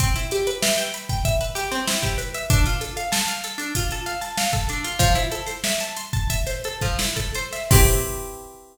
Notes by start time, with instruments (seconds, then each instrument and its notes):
0.00 acoustic guitar (steel) C4, kick, closed hi-hat
0.16 acoustic guitar (steel) E4, closed hi-hat
0.31 acoustic guitar (steel) G4, closed hi-hat
0.47 acoustic guitar (steel) B4, closed hi-hat
0.62 acoustic guitar (steel) E5, snare
0.78 acoustic guitar (steel) G5, closed hi-hat
0.94 acoustic guitar (steel) B5, closed hi-hat
1.09 acoustic guitar (steel) G5, kick, snare, closed hi-hat
1.25 acoustic guitar (steel) E5, kick, closed hi-hat
1.41 acoustic guitar (steel) B4, closed hi-hat
1.55 acoustic guitar (steel) G4, snare, closed hi-hat
1.71 acoustic guitar (steel) C4, snare, closed hi-hat
1.87 acoustic guitar (steel) E4, snare
2.02 acoustic guitar (steel) G4, kick, closed hi-hat
2.18 acoustic guitar (steel) B4, closed hi-hat
2.34 acoustic guitar (steel) E5, closed hi-hat
2.50 acoustic guitar (steel) D4, kick, closed hi-hat
2.66 acoustic guitar (steel) F4, snare, closed hi-hat
2.81 acoustic guitar (steel) A4, closed hi-hat
2.97 acoustic guitar (steel) F5, closed hi-hat
3.12 acoustic guitar (steel) A5, snare
3.28 acoustic guitar (steel) F5, closed hi-hat
3.44 acoustic guitar (steel) A4, closed hi-hat
3.58 acoustic guitar (steel) D4, closed hi-hat
3.75 acoustic guitar (steel) F4, kick, closed hi-hat
3.91 acoustic guitar (steel) A4, closed hi-hat
4.06 acoustic guitar (steel) F5, snare, closed hi-hat
4.21 acoustic guitar (steel) A5, snare, closed hi-hat
4.38 acoustic guitar (steel) F5, snare
4.53 acoustic guitar (steel) A4, kick, closed hi-hat
4.69 acoustic guitar (steel) D4, closed hi-hat
4.84 acoustic guitar (steel) F4, closed hi-hat
4.99 acoustic guitar (steel) F3, kick, closed hi-hat
5.15 acoustic guitar (steel) E4, closed hi-hat
5.32 acoustic guitar (steel) A4, closed hi-hat
5.46 acoustic guitar (steel) C5, snare, closed hi-hat
5.64 acoustic guitar (steel) E5, snare
5.80 acoustic guitar (steel) A5, closed hi-hat
5.97 acoustic guitar (steel) C6, closed hi-hat
6.13 acoustic guitar (steel) A5, kick, closed hi-hat
6.30 acoustic guitar (steel) E5, kick, closed hi-hat
6.47 acoustic guitar (steel) C5, snare, closed hi-hat
6.64 acoustic guitar (steel) A4, closed hi-hat
6.81 acoustic guitar (steel) F3, kick, snare, closed hi-hat
6.99 acoustic guitar (steel) E4, snare
7.16 acoustic guitar (steel) A4, kick, closed hi-hat
7.34 acoustic guitar (steel) C5, closed hi-hat
7.53 acoustic guitar (steel) E5, snare, closed hi-hat
7.71 acoustic guitar (steel) C4 E4 G4 B4, kick, crash